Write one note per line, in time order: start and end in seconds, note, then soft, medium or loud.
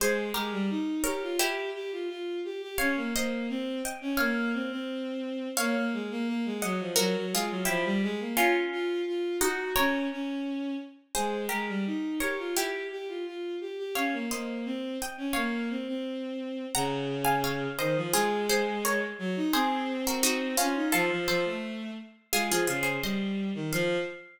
0.00 0.30 G#3 medium
0.00 0.32 G#4 medium
0.00 0.32 C5 loud
0.34 0.52 G#3 medium
0.34 1.01 G4 medium
0.34 1.01 A#4 medium
0.52 0.69 G3 medium
0.70 1.03 D#4 medium
1.04 1.21 G4 medium
1.04 1.36 A#4 medium
1.04 1.36 C#5 loud
1.22 1.39 F4 medium
1.39 2.59 E4 loud
1.39 2.59 G4 loud
1.39 1.70 G4 medium
1.74 1.91 G4 medium
1.92 2.08 F4 medium
2.09 2.40 F4 medium
2.44 2.61 G4 medium
2.62 2.78 G4 medium
2.78 2.96 C#4 medium
2.78 3.09 C#5 loud
2.78 3.09 F5 loud
2.97 3.13 A#3 medium
3.14 3.48 A#3 medium
3.14 3.81 C5 medium
3.14 3.81 D#5 medium
3.49 3.81 C4 medium
3.85 4.14 D#5 medium
3.85 4.14 G5 medium
4.01 4.18 C#4 medium
4.17 4.52 A#3 medium
4.17 4.80 C#5 loud
4.17 4.80 F5 loud
4.53 4.70 C4 medium
4.71 5.48 C4 medium
5.57 5.75 A#3 medium
5.57 6.44 C#5 loud
5.57 6.44 F5 loud
5.76 5.92 A#3 medium
5.93 6.10 G#3 medium
6.11 6.27 A#3 medium
6.28 6.45 A#3 medium
6.45 6.62 G#3 medium
6.62 6.79 F#3 medium
6.62 6.93 D#5 medium
6.62 6.93 F#5 loud
6.80 6.97 F3 medium
6.96 7.14 F#3 medium
6.96 7.26 F#4 loud
6.96 7.26 A#4 loud
7.15 7.32 F#3 medium
7.32 7.49 G#3 medium
7.32 7.68 F4 medium
7.32 7.68 G#4 loud
7.50 7.66 F#3 medium
7.65 7.84 F3 medium
7.65 7.95 E4 medium
7.65 7.95 G4 loud
7.85 8.01 G3 medium
8.02 8.19 G#3 medium
8.20 8.36 A#3 medium
8.37 9.32 C#4 loud
8.37 9.32 F4 loud
8.37 8.54 F4 medium
8.72 9.02 F4 medium
9.07 9.37 F4 medium
9.41 9.75 D#4 loud
9.41 9.75 F#4 loud
9.41 9.72 F#4 medium
9.76 10.06 C#4 medium
9.76 10.41 A#4 loud
9.76 10.41 C#5 loud
10.12 10.74 C#4 medium
11.15 11.47 G#3 medium
11.15 11.46 G#4 medium
11.15 11.46 C5 medium
11.49 11.68 G#3 medium
11.49 12.16 G4 medium
11.49 12.16 A#4 medium
11.68 11.85 G3 medium
11.86 12.19 D#4 medium
12.20 12.37 G4 medium
12.20 12.53 A#4 medium
12.20 12.53 C#5 medium
12.38 12.55 F4 medium
12.56 13.76 E4 medium
12.56 12.86 G4 medium
12.56 13.76 G4 loud
12.91 13.07 G4 medium
13.08 13.25 F4 medium
13.26 13.56 F4 medium
13.60 13.77 G4 medium
13.78 13.94 G4 medium
13.95 14.12 C#4 medium
13.95 14.26 C#5 medium
13.95 14.26 F5 loud
14.13 14.29 A#3 medium
14.30 14.64 A#3 medium
14.30 14.96 C5 medium
14.30 14.96 D#5 medium
14.65 14.97 C4 medium
15.02 15.31 D#5 medium
15.02 15.31 G5 medium
15.17 15.34 C#4 medium
15.33 15.68 A#3 medium
15.33 15.96 C#5 medium
15.33 15.96 F5 medium
15.70 15.86 C4 medium
15.87 16.65 C4 medium
16.74 17.66 C#3 medium
16.74 17.20 F#5 loud
16.74 17.20 A#5 loud
17.25 17.41 F5 loud
17.25 17.41 G#5 loud
17.44 17.73 C#5 medium
17.44 17.73 F5 loud
17.79 17.95 D#3 medium
17.79 18.08 C5 medium
17.79 18.08 D#5 loud
17.97 18.13 F3 medium
18.13 19.04 G#3 medium
18.13 18.47 F4 loud
18.13 18.47 G#4 loud
18.49 18.79 G#4 medium
18.49 18.79 C5 loud
18.85 19.01 A#4 medium
18.85 19.01 C#5 medium
19.19 19.35 F#3 medium
19.36 19.53 D#4 medium
19.53 20.55 C4 medium
19.53 19.97 G#4 loud
19.53 19.97 C5 loud
20.07 20.23 F#4 medium
20.07 20.24 A#4 medium
20.23 20.55 D#4 loud
20.23 20.55 F#4 loud
20.57 20.89 C#4 medium
20.57 20.75 C#4 medium
20.57 20.89 F4 loud
20.75 20.92 D#4 medium
20.92 21.10 F3 medium
20.92 21.09 F4 loud
20.92 21.09 A4 loud
21.10 21.27 F3 medium
21.28 21.44 F3 medium
21.28 21.92 A4 medium
21.28 21.92 C5 loud
21.45 21.91 A3 medium
22.33 22.49 G#3 medium
22.33 22.49 F4 loud
22.33 22.49 G#4 loud
22.50 22.67 F3 medium
22.50 22.67 F4 medium
22.50 22.67 G#4 loud
22.67 22.98 C#3 medium
22.67 22.84 F4 medium
22.67 22.82 G#4 medium
22.83 22.99 G#4 medium
22.83 22.99 C5 medium
23.02 23.50 G3 medium
23.02 23.68 C5 medium
23.02 23.68 D#5 medium
23.55 23.71 D#3 medium
23.72 23.96 F3 loud
23.72 23.97 F5 loud